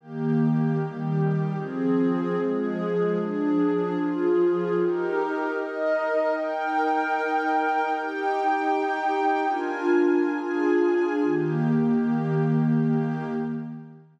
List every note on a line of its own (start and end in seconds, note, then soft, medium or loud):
0.01 0.78 D#3 medium
0.01 0.79 A#3 medium
0.01 0.78 G4 loud
0.78 1.56 D#3 medium
0.78 1.56 G3 medium
0.78 1.56 G4 medium
1.57 2.35 F3 medium
1.57 2.35 C4 medium
1.57 2.35 G#4 medium
2.38 3.15 F3 medium
2.38 3.16 G#3 medium
2.38 3.15 G#4 medium
3.16 3.94 F3 medium
3.16 3.94 D4 medium
3.16 3.94 G#4 medium
3.96 4.74 F3 loud
3.96 4.74 F4 medium
3.96 4.74 G#4 medium
4.74 5.52 D#4 medium
4.74 5.52 G4 loud
4.74 5.52 A#4 medium
5.53 6.31 D#4 medium
5.53 6.31 A#4 medium
5.53 6.31 D#5 medium
6.33 7.89 D#4 loud
6.33 7.90 A#4 medium
6.33 7.89 G5 loud
7.89 9.46 D#4 loud
7.89 9.46 G4 loud
7.89 9.46 G5 loud
9.47 10.29 D4 medium
9.47 10.29 F4 medium
9.47 10.29 A#4 medium
9.47 10.29 G#5 loud
10.29 11.20 D4 medium
10.29 11.20 F4 medium
10.29 11.20 G#4 medium
10.29 11.20 G#5 medium
11.23 13.24 D#3 loud
11.23 13.24 A#3 loud
11.23 13.24 G4 loud